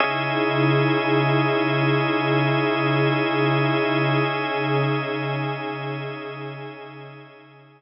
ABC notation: X:1
M:4/4
L:1/8
Q:1/4=57
K:C#dor
V:1 name="Pad 5 (bowed)"
[C,DEG]8 | [C,CDG]8 |]
V:2 name="Drawbar Organ"
[CGde]8- | [CGde]8 |]